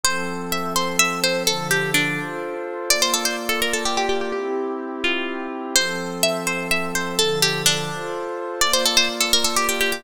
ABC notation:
X:1
M:6/8
L:1/16
Q:3/8=84
K:F
V:1 name="Pizzicato Strings"
c4 e2 c2 e2 c2 | A2 G2 D6 z2 | d c A c z A B A G G G G | G6 F4 z2 |
c4 e2 c2 e2 c2 | A2 G2 D6 z2 | d c A c z A B A G G G G |]
V:2 name="Pad 2 (warm)"
[F,CA]12 | [D,F,A]6 [FAc]6 | [B,Fd]12 | [CEG]12 |
[F,CA]12 | [D,F,A]6 [FAc]6 | [B,Fd]12 |]